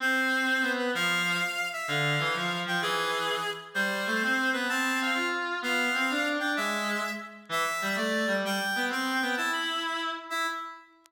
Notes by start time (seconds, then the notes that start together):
0.00 C4 C5
0.62 B3
0.78 B4
0.95 F3 F5
1.73 E5
1.87 D3 F5
2.19 E3
2.35 F3
2.66 F3 G5
2.82 E3 G#4
3.74 G3 C5
4.06 A3
4.22 C4
4.53 B3 B4
4.69 C4 A5
5.01 F5
5.14 F4
5.62 B3 F5
5.94 C4
6.10 D4
6.39 D4 G5
6.57 G#3 E5
7.49 E3 E5
7.82 G3
7.96 A3 D5
8.27 G3
8.45 G3 G5
8.76 B3
8.89 C4 G5
9.22 B3
9.37 E4 A5
9.53 B5
9.86 B5
10.30 E4 E5